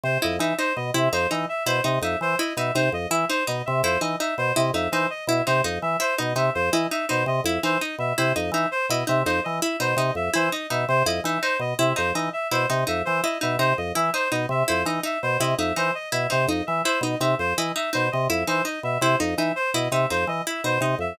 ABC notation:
X:1
M:6/8
L:1/8
Q:3/8=111
K:none
V:1 name="Drawbar Organ" clef=bass
C, F,, E, | z B,, C, F,, E, z | B,, C, F,, E, z B,, | C, F,, E, z B,, C, |
F,, E, z B,, C, F,, | E, z B,, C, F,, E, | z B,, C, F,, E, z | B,, C, F,, E, z B,, |
C, F,, E, z B,, C, | F,, E, z B,, C, F,, | E, z B,, C, F,, E, | z B,, C, F,, E, z |
B,, C, F,, E, z B,, | C, F,, E, z B,, C, | F,, E, z B,, C, F,, | E, z B,, C, F,, E, |
z B,, C, F,, E, z | B,, C, F,, E, z B,, | C, F,, E, z B,, C, | F,, E, z B,, C, F,, |]
V:2 name="Pizzicato Strings"
z E _E | _E z =E _E E z | E _E E z =E _E | _E z =E _E E z |
E _E E z =E _E | _E z =E _E E z | E _E E z =E _E | _E z =E _E E z |
E _E E z =E _E | _E z =E _E E z | E _E E z =E _E | _E z =E _E E z |
E _E E z =E _E | _E z =E _E E z | E _E E z =E _E | _E z =E _E E z |
E _E E z =E _E | _E z =E _E E z | E _E E z =E _E | _E z =E _E E z |]
V:3 name="Clarinet"
c _e =e | c _e =e c _e =e | c _e =e c _e =e | c _e =e c _e =e |
c _e =e c _e =e | c _e =e c _e =e | c _e =e c _e =e | c _e =e c _e =e |
c _e =e c _e =e | c _e =e c _e =e | c _e =e c _e =e | c _e =e c _e =e |
c _e =e c _e =e | c _e =e c _e =e | c _e =e c _e =e | c _e =e c _e =e |
c _e =e c _e =e | c _e =e c _e =e | c _e =e c _e =e | c _e =e c _e =e |]